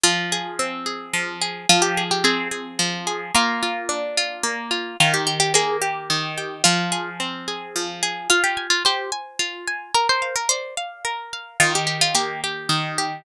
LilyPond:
<<
  \new Staff \with { instrumentName = "Orchestral Harp" } { \time 3/4 \key f \dorian \tempo 4 = 109 f'4 r2 | f'16 g'8 g'16 aes'8 r4. | f'2 r4 | f'16 g'8 g'16 aes'8 r4. |
f'4 r2 | f'16 g'8 f'16 g'8 r4. | bes'16 c''8 bes'16 c''8 r4. | f'16 g'8 f'16 g'8 r4. | }
  \new Staff \with { instrumentName = "Orchestral Harp" } { \time 3/4 \key f \dorian f8 aes'8 c'8 aes'8 f8 aes'8 | f8 aes'8 c'8 aes'8 f8 aes'8 | bes8 f'8 d'8 f'8 bes8 f'8 | ees8 g'8 bes8 g'8 ees8 g'8 |
f8 aes'8 c'8 aes'8 f8 aes'8 | f'8 aes''8 c''8 aes''8 f'8 aes''8 | bes'8 f''8 d''8 f''8 bes'8 f''8 | ees8 g'8 bes8 g'8 ees8 g'8 | }
>>